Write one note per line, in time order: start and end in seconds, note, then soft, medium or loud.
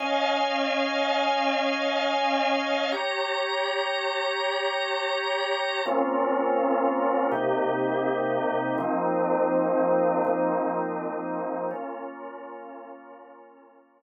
0.00 2.90 C#4 medium
0.00 2.90 D#5 medium
0.00 2.90 F5 medium
0.00 2.90 G#5 medium
2.92 5.82 G4 medium
2.92 5.82 C#5 medium
2.92 5.82 A#5 medium
5.86 7.31 A#3 medium
5.86 7.31 C4 medium
5.86 7.31 C#4 medium
5.86 7.31 F4 medium
7.32 8.76 C3 medium
7.32 8.76 A#3 medium
7.32 8.76 D#4 medium
7.32 8.76 G4 medium
8.78 10.23 F3 medium
8.78 10.23 A#3 medium
8.78 10.23 C4 medium
8.78 10.23 D#4 medium
10.25 11.70 F3 medium
10.25 11.70 A#3 medium
10.25 11.70 C4 medium
10.25 11.70 D#4 medium
11.71 14.02 A#3 medium
11.71 14.02 C#4 medium
11.71 14.02 F4 medium